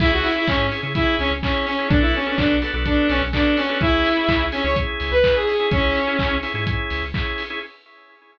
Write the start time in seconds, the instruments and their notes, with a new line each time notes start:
0.00 synth bass 2 C#2, drawbar organ C#4 E4 G#4, lead 2 (sawtooth) E4, kick, crash
0.13 lead 2 (sawtooth) F#4
0.23 lead 2 (sawtooth) E4, open hi-hat
0.36 drawbar organ C#4 E4 G#4, lead 2 (sawtooth) E4
0.47 synth bass 2 G#2, lead 2 (sawtooth) C#4, drawbar organ C#4 E4 G#4, kick, clap
0.71 drawbar organ C#4 E4 G#4, open hi-hat
0.83 synth bass 2 C#3, drawbar organ C#4 E4 G#4
0.95 drawbar organ C#4 E4 G#4, lead 2 (sawtooth) E4, kick, closed hi-hat
1.19 synth bass 2 C#2, lead 2 (sawtooth) C#4, open hi-hat
1.31 synth bass 2 C#2
1.43 drawbar organ C#4 E4 G#4, lead 2 (sawtooth) C#4, kick, clap
1.66 lead 2 (sawtooth) C#4, open hi-hat
1.79 drawbar organ C#4 E4 G#4
1.88 synth bass 2 B1, drawbar organ B3 D4 F#4 A4, lead 2 (sawtooth) D4, kick, closed hi-hat
2.01 lead 2 (sawtooth) E4
2.14 lead 2 (sawtooth) C#4, open hi-hat
2.26 drawbar organ B3 D4 F#4 A4, lead 2 (sawtooth) C#4
2.36 synth bass 2 B1, drawbar organ B3 D4 F#4 A4, lead 2 (sawtooth) D4, kick, clap
2.62 drawbar organ B3 D4 F#4 A4, open hi-hat
2.74 synth bass 2 B1, drawbar organ B3 D4 F#4 A4
2.86 drawbar organ B3 D4 F#4 A4, lead 2 (sawtooth) D4, kick, closed hi-hat
3.09 synth bass 2 B1, lead 2 (sawtooth) C#4, open hi-hat
3.22 synth bass 2 B1
3.33 drawbar organ B3 D4 F#4 A4, lead 2 (sawtooth) D4, kick, clap
3.57 lead 2 (sawtooth) C#4, open hi-hat
3.69 drawbar organ B3 D4 F#4 A4
3.81 synth bass 2 C#2, drawbar organ C#4 E4 G#4, lead 2 (sawtooth) E4, kick, closed hi-hat
4.05 open hi-hat
4.17 drawbar organ C#4 E4 G#4
4.28 synth bass 2 C#2, drawbar organ C#4 E4 G#4, kick, clap
4.52 lead 2 (sawtooth) C#4, drawbar organ C#4 E4 G#4, open hi-hat
4.64 synth bass 2 C#2, drawbar organ C#4 E4 G#4, lead 2 (sawtooth) C#5
4.76 drawbar organ C#4 E4 G#4, kick, closed hi-hat
5.00 synth bass 2 C#2, open hi-hat
5.11 synth bass 2 C#2, lead 2 (sawtooth) B4
5.24 drawbar organ C#4 E4 G#4, kick, clap
5.36 lead 2 (sawtooth) G#4
5.46 lead 2 (sawtooth) G#4, open hi-hat
5.60 drawbar organ C#4 E4 G#4
5.71 synth bass 2 C#2, drawbar organ C#4 E4 G#4, lead 2 (sawtooth) C#4, kick, closed hi-hat
5.95 open hi-hat
6.07 drawbar organ C#4 E4 G#4
6.19 synth bass 2 C#2, drawbar organ C#4 E4 G#4, kick, clap
6.43 drawbar organ C#4 E4 G#4, open hi-hat
6.54 synth bass 2 G#2, drawbar organ C#4 E4 G#4
6.67 drawbar organ C#4 E4 G#4, kick, closed hi-hat
6.90 synth bass 2 C#2, open hi-hat
7.03 synth bass 2 C#2
7.14 drawbar organ C#4 E4 G#4, kick, clap
7.38 open hi-hat
7.50 drawbar organ C#4 E4 G#4